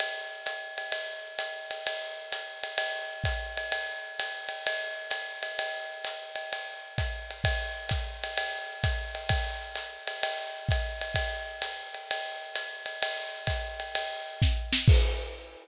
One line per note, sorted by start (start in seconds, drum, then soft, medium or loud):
0.00 ride loud
0.46 hi-hat pedal medium
0.46 ride medium
0.78 ride medium
0.92 ride medium
1.39 hi-hat pedal medium
1.39 ride medium
1.71 ride medium
1.87 ride loud
2.32 hi-hat pedal medium
2.32 ride medium
2.63 ride medium
2.78 ride loud
3.24 kick medium
3.24 hi-hat pedal medium
3.24 ride medium
3.57 ride medium
3.72 ride loud
4.19 hi-hat pedal medium
4.19 ride medium
4.49 ride medium
4.67 ride loud
5.10 hi-hat pedal medium
5.10 ride medium
5.43 ride medium
5.59 ride medium
6.05 hi-hat pedal medium
6.05 ride medium
6.36 ride medium
6.53 ride medium
6.98 kick medium
6.98 hi-hat pedal medium
6.98 ride medium
7.31 ride medium
7.44 kick medium
7.44 ride loud
7.89 kick medium
7.89 hi-hat pedal medium
7.89 ride medium
8.24 ride medium
8.37 ride loud
8.84 kick medium
8.84 hi-hat pedal medium
8.84 ride medium
9.15 ride medium
9.29 kick medium
9.29 ride loud
9.75 hi-hat pedal medium
9.75 ride medium
10.07 ride medium
10.23 ride loud
10.69 kick medium
10.69 hi-hat pedal medium
10.69 ride medium
11.01 ride medium
11.14 kick medium
11.14 ride loud
11.62 hi-hat pedal medium
11.62 ride medium
11.94 ride medium
12.11 ride loud
12.55 hi-hat pedal medium
12.55 ride medium
12.86 ride medium
13.03 ride loud
13.47 kick medium
13.47 hi-hat pedal medium
13.47 ride medium
13.80 ride medium
13.95 ride loud
14.42 kick medium
14.42 snare medium
14.73 snare loud
14.88 kick loud
14.88 crash loud